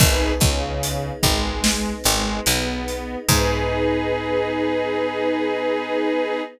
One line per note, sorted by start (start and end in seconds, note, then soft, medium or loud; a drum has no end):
0.00 0.34 G#1 loud
0.00 3.26 B3 medium
0.00 0.32 D#4 loud
0.00 3.26 D#4 medium
0.00 0.32 G#4 medium
0.00 3.26 G#4 medium
0.00 0.32 B4 loud
0.00 kick loud
0.00 crash loud
0.40 1.11 C#2 medium
0.40 1.10 C#3 medium
0.40 kick loud
0.40 closed hi-hat medium
0.83 closed hi-hat loud
1.23 1.93 G#1 loud
1.23 1.93 G#3 medium
1.23 kick loud
1.23 closed hi-hat medium
1.64 snare loud
2.04 2.40 G#1 loud
2.04 2.40 G#3 loud
2.04 closed hi-hat medium
2.46 3.16 B1 loud
2.46 3.16 B3 medium
2.46 closed hi-hat loud
2.88 closed hi-hat medium
3.28 6.41 G#2 loud
3.28 6.41 B3 loud
3.28 6.41 D#4 loud
3.28 6.42 D#4 loud
3.28 6.41 G#4 loud
3.28 6.42 G#4 loud
3.28 6.42 B4 medium
3.28 kick loud
3.28 crash loud